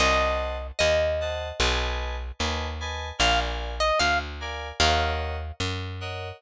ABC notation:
X:1
M:4/4
L:1/16
Q:1/4=75
K:Ebdor
V:1 name="Pizzicato Strings"
e4 e8 z4 | f z2 e f z3 f4 z4 |]
V:2 name="Electric Piano 2"
[ceg=a]6 [cega]2 [=B^d^ga]4 [Bdga]2 [Bdga]2 | [B=dfa]6 [Bdfa]2 [B_deg]6 [Bdeg]2 |]
V:3 name="Electric Bass (finger)" clef=bass
C,,4 E,,4 =B,,,4 ^D,,4 | B,,,4 =D,,4 E,,4 G,,4 |]